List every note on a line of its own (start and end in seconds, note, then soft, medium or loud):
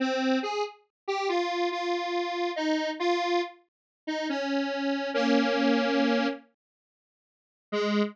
0.00 0.39 C4 medium
0.43 0.63 G#4 medium
1.08 1.28 G4 medium
1.29 1.69 F4 medium
1.72 2.51 F4 medium
2.56 2.90 D#4 medium
2.99 3.41 F4 medium
4.07 4.28 D#4 medium
4.29 5.10 C#4 medium
5.14 6.27 A#3 medium
5.14 6.27 C#4 medium
7.72 8.02 G#3 loud